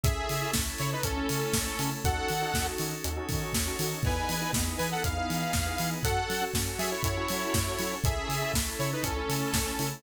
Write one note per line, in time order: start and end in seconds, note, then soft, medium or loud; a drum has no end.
0.03 0.17 C#2 medium
0.03 0.34 C#4 loud
0.03 1.04 C#4 medium
0.03 0.34 E4 loud
0.03 1.04 E4 medium
0.03 0.51 G#4 medium
0.03 0.34 A4 loud
0.03 1.04 A4 medium
0.03 0.51 E5 medium
0.03 kick loud
0.03 closed hi-hat medium
0.29 0.43 C#3 medium
0.29 open hi-hat medium
0.42 0.52 C#4 medium
0.42 0.52 E4 loud
0.42 0.52 A4 medium
0.53 0.68 C#2 medium
0.53 0.94 C#4 medium
0.53 0.94 E4 medium
0.53 0.94 A4 medium
0.53 kick medium
0.53 snare loud
0.78 0.94 C#3 medium
0.78 0.91 E4 medium
0.78 0.91 C#5 medium
0.78 open hi-hat medium
0.92 1.04 D#4 medium
0.92 1.04 B4 medium
1.03 1.18 C#2 medium
1.03 2.03 A3 medium
1.03 1.90 C#4 medium
1.03 1.14 C#4 medium
1.03 2.03 C#4 medium
1.03 1.14 E4 medium
1.03 1.90 A4 medium
1.03 1.14 A4 medium
1.03 2.03 A4 medium
1.03 kick medium
1.03 closed hi-hat medium
1.16 1.56 C#4 loud
1.16 1.56 E4 medium
1.16 1.56 A4 medium
1.29 1.44 C#3 medium
1.29 open hi-hat medium
1.53 1.68 C#2 medium
1.53 kick medium
1.53 snare loud
1.66 1.76 C#4 loud
1.66 1.76 E4 medium
1.66 1.76 A4 loud
1.79 1.93 C#3 medium
1.79 1.99 C#4 loud
1.79 1.99 E4 medium
1.79 1.99 A4 medium
1.79 open hi-hat medium
2.04 2.18 D#2 medium
2.04 3.03 C#4 medium
2.04 2.34 C#4 loud
2.04 3.03 D#4 medium
2.04 2.34 D#4 medium
2.04 3.03 F#4 medium
2.04 2.34 F#4 loud
2.04 3.03 A4 medium
2.04 2.34 A4 loud
2.04 2.67 A4 medium
2.04 2.67 F#5 medium
2.04 kick medium
2.04 closed hi-hat medium
2.28 2.44 D#3 medium
2.28 open hi-hat medium
2.41 2.51 C#4 medium
2.41 2.51 D#4 loud
2.41 2.51 F#4 medium
2.41 2.51 A4 medium
2.54 2.67 D#2 medium
2.54 2.94 C#4 medium
2.54 2.94 D#4 medium
2.54 2.94 F#4 medium
2.54 2.94 A4 medium
2.54 kick medium
2.54 snare medium
2.78 2.93 D#3 medium
2.78 open hi-hat medium
3.04 3.18 D#2 medium
3.04 4.03 C#4 medium
3.04 3.14 C#4 medium
3.04 4.03 D#4 medium
3.04 3.14 D#4 medium
3.04 3.14 F#4 loud
3.04 4.03 A4 medium
3.04 3.14 A4 medium
3.04 4.03 C#5 medium
3.04 closed hi-hat medium
3.16 3.56 C#4 loud
3.16 3.56 D#4 medium
3.16 3.56 F#4 medium
3.16 3.56 A4 medium
3.29 3.43 D#3 medium
3.29 kick medium
3.29 open hi-hat medium
3.53 3.68 D#2 medium
3.53 kick medium
3.53 snare loud
3.66 3.76 C#4 medium
3.66 3.76 D#4 medium
3.66 3.76 F#4 loud
3.66 3.76 A4 medium
3.79 3.93 D#3 medium
3.79 3.99 C#4 medium
3.79 3.99 D#4 medium
3.79 3.99 F#4 medium
3.79 3.99 A4 medium
3.79 open hi-hat medium
4.03 4.18 E2 medium
4.03 4.34 B3 loud
4.03 5.03 B3 medium
4.03 4.34 D#4 loud
4.03 5.03 D#4 medium
4.03 4.34 E4 loud
4.03 5.03 E4 medium
4.03 4.34 G#4 loud
4.03 5.03 G#4 medium
4.03 4.51 B4 medium
4.03 4.51 G#5 medium
4.03 kick medium
4.03 crash medium
4.29 4.43 E3 medium
4.29 open hi-hat medium
4.41 4.51 B3 medium
4.41 4.51 D#4 loud
4.41 4.51 E4 medium
4.41 4.51 G#4 medium
4.53 4.68 E2 medium
4.53 4.94 B3 medium
4.53 4.94 D#4 medium
4.53 4.94 E4 medium
4.53 4.94 G#4 medium
4.53 kick medium
4.53 snare loud
4.78 4.93 E3 medium
4.78 4.90 B4 medium
4.78 4.90 G#5 medium
4.78 open hi-hat medium
4.91 5.03 A4 medium
4.91 5.03 F#5 medium
5.04 5.18 E2 medium
5.04 5.14 B3 loud
5.04 6.04 B3 medium
5.04 5.14 D#4 medium
5.04 6.04 D#4 medium
5.04 5.14 E4 medium
5.04 5.14 G#4 medium
5.04 6.04 G#4 medium
5.04 6.04 B4 medium
5.04 5.90 F5 medium
5.04 kick medium
5.04 closed hi-hat medium
5.17 5.57 B3 medium
5.17 5.57 D#4 medium
5.17 5.57 E4 medium
5.17 5.57 G#4 medium
5.30 5.44 E3 medium
5.30 open hi-hat medium
5.53 5.68 E2 medium
5.53 kick medium
5.53 snare medium
5.66 5.76 B3 medium
5.66 5.76 D#4 medium
5.66 5.76 E4 medium
5.66 5.76 G#4 medium
5.78 5.93 E3 medium
5.78 5.99 B3 medium
5.78 5.99 D#4 medium
5.78 5.99 E4 medium
5.78 5.99 G#4 loud
5.78 open hi-hat medium
6.03 6.17 F#2 medium
6.03 6.34 C#4 loud
6.03 7.03 C#4 medium
6.03 6.34 F#4 loud
6.03 7.03 F#4 medium
6.03 6.34 A4 loud
6.03 6.44 A4 medium
6.03 7.03 A4 medium
6.03 6.44 F#5 medium
6.03 kick medium
6.03 closed hi-hat medium
6.30 6.43 F#3 medium
6.30 open hi-hat medium
6.41 6.51 C#4 medium
6.41 6.51 F#4 loud
6.41 6.51 A4 medium
6.54 6.68 F#2 medium
6.54 6.94 C#4 loud
6.54 6.94 F#4 medium
6.54 6.94 A4 medium
6.54 kick medium
6.54 snare loud
6.78 6.92 F#3 medium
6.78 6.90 G#4 medium
6.78 6.90 E5 medium
6.78 open hi-hat medium
6.91 7.02 E4 medium
6.91 7.02 C#5 medium
7.03 7.18 F#2 medium
7.03 8.02 C#4 medium
7.03 7.14 C#4 medium
7.03 7.95 E4 medium
7.03 7.14 F#4 medium
7.03 8.02 A4 medium
7.03 7.14 A4 medium
7.03 8.02 C#5 medium
7.03 7.95 C#5 medium
7.03 kick medium
7.03 closed hi-hat medium
7.17 7.57 C#4 medium
7.17 7.57 F#4 loud
7.17 7.57 A4 medium
7.28 7.44 F#3 medium
7.28 open hi-hat medium
7.54 7.68 F#2 medium
7.54 kick medium
7.54 snare loud
7.66 7.76 C#4 medium
7.66 7.76 F#4 medium
7.66 7.76 A4 medium
7.78 7.93 F#3 medium
7.78 7.99 C#4 medium
7.78 7.99 F#4 medium
7.78 7.99 A4 medium
7.78 open hi-hat medium
8.04 8.18 C#2 medium
8.04 9.03 C#4 medium
8.04 8.34 C#4 loud
8.04 9.03 E4 medium
8.04 8.34 E4 loud
8.04 8.52 G#4 medium
8.04 9.03 A4 medium
8.04 8.34 A4 loud
8.04 8.52 E5 medium
8.04 kick loud
8.04 closed hi-hat medium
8.29 8.42 C#3 medium
8.29 open hi-hat medium
8.42 8.52 C#4 medium
8.42 8.52 E4 loud
8.42 8.52 A4 medium
8.53 8.67 C#2 medium
8.53 8.94 C#4 medium
8.53 8.94 E4 medium
8.53 8.94 A4 medium
8.53 kick medium
8.53 snare loud
8.79 8.93 C#3 medium
8.79 8.91 E4 medium
8.79 8.91 C#5 medium
8.79 open hi-hat medium
8.93 9.04 D#4 medium
8.93 9.04 B4 medium
9.02 9.19 C#2 medium
9.02 10.02 A3 medium
9.02 9.89 C#4 medium
9.02 10.02 C#4 medium
9.02 9.14 C#4 medium
9.02 9.14 E4 medium
9.02 9.89 A4 medium
9.02 10.02 A4 medium
9.02 9.14 A4 medium
9.02 kick medium
9.02 closed hi-hat medium
9.16 9.56 C#4 loud
9.16 9.56 E4 medium
9.16 9.56 A4 medium
9.29 9.43 C#3 medium
9.29 open hi-hat medium
9.53 9.67 C#2 medium
9.53 kick medium
9.53 snare loud
9.66 9.76 C#4 loud
9.66 9.76 E4 medium
9.66 9.76 A4 loud
9.79 9.93 C#3 medium
9.79 9.99 C#4 loud
9.79 9.99 E4 medium
9.79 9.99 A4 medium
9.79 open hi-hat medium